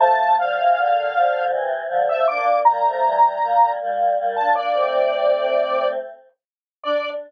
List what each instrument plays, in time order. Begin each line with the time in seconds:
0.00 choir aahs F3 A3, lead 1 (square) A5
0.39 choir aahs D3 F3, lead 1 (square) F5
0.58 choir aahs C3 E3
0.76 choir aahs A#2 D3
1.16 choir aahs D3 F3
1.50 choir aahs C3 E3
1.88 choir aahs D3 F3
2.09 choir aahs F3 A3, lead 1 (square) E5
2.28 choir aahs A#3 D4, lead 1 (square) D6
2.65 choir aahs G3 A#3, lead 1 (square) A#5
2.85 choir aahs F3 A3
3.03 choir aahs E3 G3
3.42 choir aahs G3 A#3
3.81 choir aahs G3 A#3
4.18 choir aahs G3 A#3
4.36 choir aahs A#3 D4, lead 1 (square) A5
4.55 choir aahs A#3 D4, lead 1 (square) D5
4.74 choir aahs A3 C4
6.84 choir aahs D4, lead 1 (square) D5